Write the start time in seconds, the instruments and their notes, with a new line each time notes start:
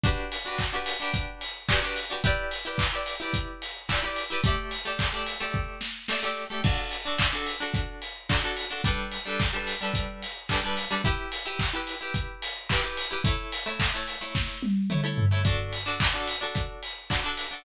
0.04 acoustic guitar (steel) D4 F#4 G4 B4, kick, closed hi-hat
0.32 open hi-hat
0.45 acoustic guitar (steel) D4 F#4 G4 B4
0.58 kick, clap
0.72 acoustic guitar (steel) D4 F#4 G4 B4
0.86 open hi-hat
1.00 acoustic guitar (steel) D4 F#4 G4 B4
1.14 kick, closed hi-hat
1.41 open hi-hat
1.69 acoustic guitar (steel) D4 F#4 G4 B4, kick, clap
1.83 acoustic guitar (steel) D4 F#4 G4 B4
1.96 open hi-hat
2.10 acoustic guitar (steel) D4 F#4 G4 B4
2.24 acoustic guitar (steel) E4 G4 B4 D5, kick, closed hi-hat
2.51 open hi-hat
2.65 acoustic guitar (steel) E4 G4 B4 D5
2.78 kick, clap
2.92 acoustic guitar (steel) E4 G4 B4 D5
3.06 open hi-hat
3.20 acoustic guitar (steel) E4 G4 B4 D5
3.33 kick, closed hi-hat
3.62 open hi-hat
3.89 acoustic guitar (steel) E4 G4 B4 D5, kick, clap
4.03 acoustic guitar (steel) E4 G4 B4 D5
4.16 open hi-hat
4.30 acoustic guitar (steel) E4 G4 B4 D5
4.44 acoustic guitar (steel) A3 G4 D5 E5, kick, closed hi-hat
4.71 open hi-hat
4.85 acoustic guitar (steel) A3 G4 D5 E5
4.99 kick, clap
5.13 acoustic guitar (steel) A3 G4 D5 E5
5.26 open hi-hat
5.40 acoustic guitar (steel) A3 G4 D5 E5
5.54 kick
5.81 snare
6.08 acoustic guitar (steel) A3 G4 D5, snare
6.12 acoustic guitar (steel) E5
6.23 acoustic guitar (steel) A3 G4 D5 E5
6.50 acoustic guitar (steel) A3 G4 D5 E5
6.64 acoustic guitar (steel) D4 F#4 A4, kick, crash
6.91 open hi-hat
7.05 acoustic guitar (steel) D4 F#4 A4
7.18 kick, clap
7.33 acoustic guitar (steel) D4 F#4 A4
7.47 open hi-hat
7.60 acoustic guitar (steel) D4 F#4 A4
7.74 kick, closed hi-hat
8.02 open hi-hat
8.29 acoustic guitar (steel) D4 F#4 A4, kick, clap
8.43 acoustic guitar (steel) D4 F#4 A4
8.57 open hi-hat
8.70 acoustic guitar (steel) D4 F#4 A4
8.84 acoustic guitar (steel) G3 D4 A4 B4, kick, closed hi-hat
9.12 open hi-hat
9.26 acoustic guitar (steel) G3 D4 A4 B4
9.40 kick, clap
9.53 acoustic guitar (steel) G3 D4 A4 B4
9.67 open hi-hat
9.81 acoustic guitar (steel) G3 D4 A4 B4
9.94 kick, closed hi-hat
10.22 open hi-hat
10.49 acoustic guitar (steel) G3 D4 A4 B4, kick, clap
10.63 acoustic guitar (steel) G3 D4 A4 B4
10.77 open hi-hat
10.91 acoustic guitar (steel) G3 D4 A4 B4
11.04 acoustic guitar (steel) E4 G4 B4, kick, closed hi-hat
11.32 open hi-hat
11.46 acoustic guitar (steel) E4 G4 B4
11.59 kick, clap
11.73 acoustic guitar (steel) E4 G4 B4
11.87 open hi-hat
12.01 acoustic guitar (steel) E4 G4 B4
12.14 kick, closed hi-hat
12.42 open hi-hat
12.69 acoustic guitar (steel) E4 G4 B4, kick, clap
12.83 acoustic guitar (steel) E4 G4 B4
12.97 open hi-hat
13.11 acoustic guitar (steel) E4 G4 B4
13.24 acoustic guitar (steel) A3 E4 C#5, kick, closed hi-hat
13.52 open hi-hat
13.66 acoustic guitar (steel) A3 E4 C#5
13.80 kick, clap
13.94 acoustic guitar (steel) A3 E4 C#5
14.08 open hi-hat
14.21 acoustic guitar (steel) A3 E4 C#5
14.35 kick, snare
14.63 high tom
14.90 acoustic guitar (steel) A3 E4 C#5, mid tom
15.04 acoustic guitar (steel) A3 E4 C#5
15.18 floor tom
15.31 acoustic guitar (steel) A3 E4 C#5
15.45 acoustic guitar (steel) D4 F#4 A4, kick, closed hi-hat
15.73 open hi-hat
15.86 acoustic guitar (steel) D4 F#4 A4
16.00 kick, clap
16.14 acoustic guitar (steel) D4 F#4 A4
16.28 open hi-hat
16.41 acoustic guitar (steel) D4 F#4 A4
16.55 kick, closed hi-hat
16.83 open hi-hat
17.10 acoustic guitar (steel) D4 F#4 A4, kick, clap
17.24 acoustic guitar (steel) D4 F#4 A4
17.37 open hi-hat
17.51 acoustic guitar (steel) D4 F#4 A4